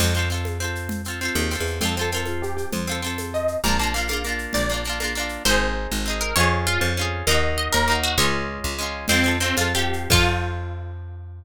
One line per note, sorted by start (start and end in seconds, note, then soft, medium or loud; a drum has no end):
0.00 1.29 F2 loud
0.00 0.14 C4 medium
0.00 0.14 F4 medium
0.00 crash loud
0.00 low conga loud
0.00 shaker medium
0.04 0.14 A4 medium
0.15 0.29 C4 medium
0.15 0.29 F4 medium
0.15 shaker medium
0.19 0.29 A4 medium
0.30 0.58 C4 medium
0.30 0.58 F4 medium
0.30 shaker medium
0.34 0.58 A4 medium
0.45 high conga medium
0.45 shaker medium
0.60 1.02 C4 medium
0.60 1.02 F4 medium
0.60 shaker medium
0.64 1.02 A4 medium
0.75 shaker medium
0.89 low conga loud
0.89 shaker medium
1.04 1.20 C4 medium
1.04 1.20 F4 medium
1.04 shaker medium
1.10 1.20 A4 medium
1.21 1.49 C4 medium
1.21 1.49 F4 medium
1.21 shaker medium
1.25 1.49 A4 medium
1.35 1.56 D#2 medium
1.35 high conga medium
1.35 shaker medium
1.50 1.79 C4 medium
1.50 1.79 F4 medium
1.50 shaker medium
1.55 1.79 A4 medium
1.60 1.81 E2 medium
1.66 shaker medium
1.81 2.65 F2 medium
1.81 1.95 C4 loud
1.81 1.95 F4 loud
1.81 1.95 C5 medium
1.81 low conga loud
1.81 shaker medium
1.85 1.95 A4 loud
1.97 2.11 C4 medium
1.97 2.11 F4 medium
1.97 2.10 A4 medium
1.97 shaker medium
2.01 2.11 A4 medium
2.12 2.82 C4 medium
2.12 2.82 F4 medium
2.12 2.25 A#4 medium
2.12 shaker medium
2.17 2.82 A4 medium
2.26 2.42 F4 medium
2.26 high conga medium
2.26 shaker medium
2.42 2.56 G4 medium
2.42 shaker medium
2.57 2.70 G4 medium
2.57 shaker medium
2.72 3.56 F2 medium
2.72 3.21 C5 medium
2.72 low conga loud
2.72 shaker medium
2.87 3.01 C4 medium
2.87 3.01 F4 medium
2.87 shaker medium
2.92 3.01 A4 medium
3.02 3.58 C4 medium
3.02 3.58 F4 medium
3.02 shaker medium
3.07 3.58 A4 medium
3.18 high conga medium
3.18 shaker medium
3.34 3.60 D#5 medium
3.34 shaker medium
3.48 shaker medium
3.64 4.47 A#1 medium
3.64 3.78 A#3 medium
3.64 3.78 D4 loud
3.64 3.78 A#5 medium
3.64 low conga loud
3.64 shaker medium
3.68 3.78 F4 loud
3.79 3.93 A#3 medium
3.79 3.93 D4 medium
3.79 3.94 A5 medium
3.79 shaker medium
3.84 3.93 F4 loud
3.94 4.08 A#3 medium
3.94 4.08 D4 medium
3.94 4.08 F5 medium
3.94 shaker medium
3.98 4.08 F4 medium
4.08 4.23 A#3 medium
4.08 4.23 D4 medium
4.08 4.38 F5 medium
4.08 high conga medium
4.08 shaker medium
4.13 4.23 F4 medium
4.24 4.66 A#3 medium
4.24 4.66 D4 medium
4.24 shaker medium
4.29 4.66 F4 medium
4.39 shaker medium
4.53 5.38 A#1 medium
4.53 5.07 D5 medium
4.53 low conga medium
4.53 shaker medium
4.69 4.84 A#3 medium
4.69 4.84 D4 medium
4.69 shaker medium
4.74 4.84 F4 medium
4.84 4.99 A#3 medium
4.84 4.99 D4 medium
4.84 shaker medium
4.89 4.99 F4 medium
5.00 5.14 A#3 medium
5.00 5.14 D4 medium
5.00 high conga medium
5.00 shaker medium
5.04 5.14 F4 medium
5.15 5.43 A#3 medium
5.15 5.43 D4 medium
5.15 shaker medium
5.19 5.43 F4 medium
5.29 shaker medium
5.45 5.87 G#1 medium
5.45 6.02 C4 loud
5.45 6.02 D#4 loud
5.45 6.16 C5 medium
5.50 6.02 G#4 medium
5.91 6.33 G#1 medium
6.06 6.33 C4 medium
6.06 6.33 D#4 medium
6.10 6.33 G#4 medium
6.21 6.35 A#4 medium
6.36 6.78 F2 medium
6.36 6.92 C#4 loud
6.36 6.92 F4 loud
6.36 6.65 C#5 medium
6.40 6.92 G#4 loud
6.67 6.94 F4 medium
6.81 7.23 F2 medium
6.97 7.25 C#4 medium
6.97 7.25 F4 medium
7.01 7.25 G#4 medium
7.27 7.69 D#2 medium
7.27 7.83 A#3 loud
7.27 7.83 D#4 loud
7.27 7.54 D#5 medium
7.31 7.83 F#4 loud
7.58 7.72 D#5 medium
7.72 8.16 D#2 medium
7.72 7.98 A#4 medium
7.88 8.16 A#3 medium
7.88 8.16 D#4 medium
7.92 8.16 F#4 medium
8.03 8.16 F#4 medium
8.18 8.59 C#2 medium
8.18 8.74 G#3 loud
8.18 8.74 C#4 loud
8.18 8.43 C#5 medium
8.22 8.74 F4 medium
8.64 9.06 C#2 medium
8.78 9.06 G#3 medium
8.78 9.06 C#4 medium
8.83 9.06 F4 medium
9.08 9.53 F2 medium
9.08 9.23 C4 loud
9.08 9.37 C4 medium
9.08 9.23 F4 loud
9.08 crash loud
9.08 low conga loud
9.08 shaker medium
9.13 9.23 A4 medium
9.24 9.39 C4 medium
9.24 9.39 F4 medium
9.24 shaker medium
9.28 9.39 A4 medium
9.40 9.56 C4 medium
9.40 9.56 F4 medium
9.40 shaker medium
9.44 9.56 A4 medium
9.57 10.07 F2 medium
9.57 9.73 C4 medium
9.57 9.73 F4 medium
9.57 high conga medium
9.57 shaker medium
9.61 9.73 A4 medium
9.74 10.08 C4 medium
9.74 10.08 F4 medium
9.74 10.09 G4 medium
9.74 shaker medium
9.79 10.08 A4 medium
9.93 shaker medium
10.10 11.42 F2 medium
10.10 11.43 C4 medium
10.10 11.44 F4 loud
10.10 11.43 F4 medium
10.10 kick loud
10.10 crash loud
10.15 11.43 A4 medium